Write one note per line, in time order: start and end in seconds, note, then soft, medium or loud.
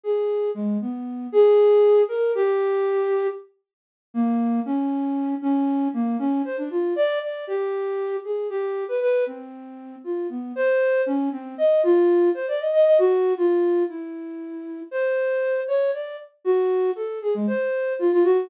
0.03 0.50 G#4 medium
0.54 0.78 G#3 medium
0.81 1.27 B3 medium
1.32 2.01 G#4 loud
2.09 2.32 A#4 medium
2.35 3.27 G4 loud
4.14 4.60 A#3 loud
4.65 5.35 C#4 loud
5.42 5.88 C#4 loud
5.94 6.17 A#3 medium
6.19 6.42 C#4 loud
6.45 6.56 C5 medium
6.57 6.69 D4 medium
6.70 6.93 F4 medium
6.96 7.19 D5 loud
7.22 7.45 D5 medium
7.47 8.16 G4 medium
8.24 8.47 G#4 soft
8.50 8.84 G4 medium
8.88 9.00 B4 medium
9.01 9.24 B4 loud
9.26 9.96 C4 medium
10.04 10.27 F4 soft
10.29 10.52 B3 medium
10.56 11.02 C5 loud
11.06 11.29 C#4 loud
11.32 11.55 C4 medium
11.58 11.81 D#5 medium
11.83 12.29 F4 loud
12.34 12.46 C5 medium
12.48 12.59 D5 medium
12.60 12.72 D#5 medium
12.73 12.85 D#5 loud
12.86 12.97 D#5 loud
12.99 13.33 F#4 loud
13.37 13.83 F4 medium
13.88 14.81 E4 soft
14.91 15.60 C5 medium
15.68 15.91 C#5 medium
15.93 16.16 D5 medium
16.44 16.91 F#4 loud
16.96 17.19 A4 medium
17.22 17.33 G#4 medium
17.34 17.46 G#3 medium
17.47 17.93 C5 medium
17.99 18.11 F4 medium
18.12 18.23 F4 loud
18.24 18.47 F#4 loud